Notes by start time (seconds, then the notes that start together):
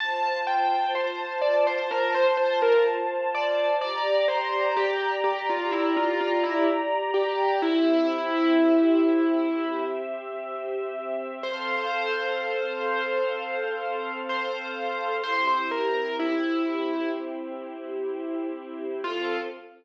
0.00 F4 C5 A5
0.47 G5
0.95 C5
1.41 D5
1.67 C5
1.91 A#4
2.14 C5
2.37 C5
2.62 A#4
3.35 D5
3.80 G4 D5 A#5
4.28 C5
4.77 G4
5.24 G4
5.49 F4
5.71 E4
5.96 F4
6.21 F4
6.43 E4
7.14 G4
7.62 C4 E4 G4 E5
11.43 C4 A4 C5 F5
14.29 C5
15.24 C4 E4 G4 C5
15.47 C5
15.71 A#4
16.19 E4
19.04 F3 C4 F4 A4